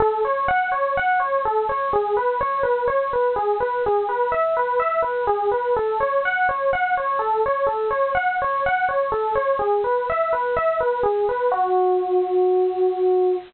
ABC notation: X:1
M:4/4
L:1/8
Q:1/4=125
K:F#m
V:1 name="Electric Piano 1"
A c f c f c A c | G B c B c B G B | G B e B e B G B | A c f c f c A c |
A c f c f c A c | G B e B e B G B | F8 |]